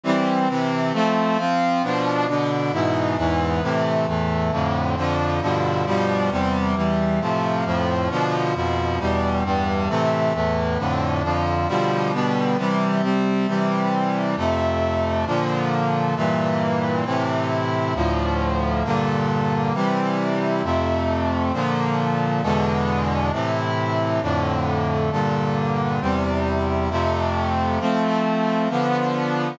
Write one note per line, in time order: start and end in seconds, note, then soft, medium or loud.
0.04 0.48 E3 medium
0.04 0.48 G3 medium
0.04 0.48 C4 medium
0.48 0.93 C3 medium
0.48 0.93 E3 medium
0.48 0.93 C4 medium
0.93 1.37 F3 medium
0.93 1.37 A3 medium
0.93 1.37 C4 medium
1.38 1.82 F3 medium
1.38 1.82 C4 medium
1.38 1.82 F4 medium
1.83 2.27 B2 medium
1.83 2.27 F3 medium
1.83 2.27 D4 medium
2.27 2.72 B2 medium
2.27 2.72 D3 medium
2.27 2.72 D4 medium
2.72 3.17 G#2 medium
2.72 3.17 B2 medium
2.72 3.17 E3 medium
3.17 3.61 E2 medium
3.17 3.61 G#2 medium
3.17 3.61 E3 medium
3.62 4.06 A2 medium
3.62 4.06 C3 medium
3.62 4.06 E3 medium
4.07 4.51 E2 medium
4.07 4.51 A2 medium
4.07 4.51 E3 medium
4.51 4.96 F2 medium
4.51 4.96 A2 medium
4.51 4.96 D3 medium
4.96 5.40 F2 medium
4.96 5.40 D3 medium
4.96 5.40 F3 medium
5.41 5.85 G2 medium
5.41 5.85 B2 medium
5.41 5.85 D3 medium
5.41 5.85 F3 medium
5.86 6.30 G2 medium
5.86 6.30 B2 medium
5.86 6.30 F3 medium
5.86 6.30 G3 medium
6.30 6.75 E2 medium
6.30 6.75 C3 medium
6.30 6.75 G3 medium
6.75 7.19 E2 medium
6.75 7.19 E3 medium
6.75 7.19 G3 medium
7.20 7.64 A2 medium
7.20 7.64 C3 medium
7.20 7.64 F3 medium
7.65 8.09 F2 medium
7.65 8.09 A2 medium
7.65 8.09 F3 medium
8.10 8.54 B2 medium
8.10 8.54 D3 medium
8.10 8.54 F3 medium
8.54 8.99 F2 medium
8.54 8.99 B2 medium
8.54 8.99 F3 medium
8.99 9.43 E2 medium
8.99 9.43 B2 medium
8.99 9.43 G3 medium
9.44 9.88 E2 medium
9.44 9.88 G2 medium
9.44 9.88 G3 medium
9.89 10.33 A2 medium
9.89 10.33 C3 medium
9.89 10.33 E3 medium
10.33 10.78 E2 medium
10.33 10.78 A2 medium
10.33 10.78 E3 medium
10.78 11.22 F2 medium
10.78 11.22 A2 medium
10.78 11.22 D3 medium
11.23 11.67 F2 medium
11.23 11.67 D3 medium
11.23 11.67 F3 medium
11.68 12.12 B2 medium
11.68 12.12 D3 medium
11.68 12.12 F3 medium
11.68 12.12 G3 medium
12.12 12.57 B2 medium
12.12 12.57 D3 medium
12.12 12.57 G3 medium
12.12 12.57 B3 medium
12.57 13.02 C3 medium
12.57 13.02 E3 medium
12.57 13.02 G3 medium
13.02 13.46 C3 medium
13.02 13.46 G3 medium
13.02 13.46 C4 medium
13.47 14.36 C3 medium
13.47 14.36 E3 medium
13.47 14.36 G3 medium
14.36 15.25 F2 medium
14.36 15.25 C3 medium
14.36 15.25 A3 medium
15.26 16.15 A#2 medium
15.26 16.15 D3 medium
15.26 16.15 F3 medium
16.15 17.04 G2 medium
16.15 17.04 A#2 medium
16.15 17.04 E3 medium
17.05 17.94 A2 medium
17.05 17.94 C3 medium
17.05 17.94 E3 medium
17.95 18.83 D2 medium
17.95 18.83 A2 medium
17.95 18.83 F3 medium
18.84 19.73 G2 medium
18.84 19.73 A#2 medium
18.84 19.73 D3 medium
19.74 20.62 C3 medium
19.74 20.62 E3 medium
19.74 20.62 G3 medium
20.63 21.52 F2 medium
20.63 21.52 C3 medium
20.63 21.52 A3 medium
21.53 22.42 A#2 medium
21.53 22.42 D3 medium
21.53 22.42 F3 medium
22.42 23.31 E2 medium
22.42 23.31 B2 medium
22.42 23.31 D3 medium
22.42 23.31 G#3 medium
23.32 24.21 A2 medium
23.32 24.21 C3 medium
23.32 24.21 E3 medium
24.21 25.10 F2 medium
24.21 25.10 A2 medium
24.21 25.10 D3 medium
25.11 26.00 G2 medium
25.11 26.00 A#2 medium
25.11 26.00 D3 medium
26.01 26.89 E2 medium
26.01 26.89 C3 medium
26.01 26.89 G3 medium
26.90 27.79 F2 medium
26.90 27.79 C3 medium
26.90 27.79 A3 medium
27.80 28.68 F3 medium
27.80 28.68 A3 medium
27.80 28.68 C4 medium
28.69 29.58 D3 medium
28.69 29.58 F3 medium
28.69 29.58 B3 medium